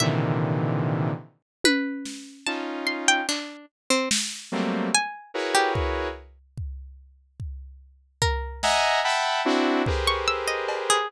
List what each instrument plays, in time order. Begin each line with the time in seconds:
0.00 lead 2 (sawtooth) A#2 C3 D3 D#3 E3, pizzicato strings E5, high tom
1.64 pizzicato strings B4, high tom
2.05 snare
2.47 lead 2 (sawtooth) C#4 D#4 F4, pizzicato strings A5
2.87 pizzicato strings C6
3.08 pizzicato strings G5
3.29 pizzicato strings D4, clap
3.90 pizzicato strings C4
4.11 snare
4.52 lead 2 (sawtooth) F#3 G3 A3 A#3 C4
4.95 pizzicato strings G#5
5.34 lead 2 (sawtooth) E4 F#4 G#4 A#4 B4 C#5
5.55 pizzicato strings G4
5.75 kick
6.58 kick
7.40 kick
8.22 pizzicato strings A#4, kick
8.63 lead 2 (sawtooth) D#5 E5 F#5 G#5 A#5, snare
9.04 lead 2 (sawtooth) E5 F#5 G5 A5 B5
9.45 lead 2 (sawtooth) C4 D4 E4 F#4
9.86 lead 2 (sawtooth) G4 G#4 A#4 B4 C5, kick
10.07 pizzicato strings C#6
10.28 pizzicato strings E6
10.48 pizzicato strings D#5
10.68 cowbell
10.90 pizzicato strings G#4